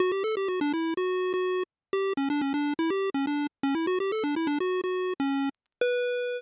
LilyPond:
\new Staff { \time 4/4 \key b \minor \tempo 4 = 124 fis'16 g'16 a'16 g'16 fis'16 d'16 e'8 fis'8. fis'8. r8 | g'8 cis'16 d'16 cis'16 d'8 e'16 g'8 cis'16 d'8 r16 cis'16 e'16 | fis'16 g'16 a'16 d'16 e'16 d'16 fis'8 fis'8. cis'8. r8 | b'4. r2 r8 | }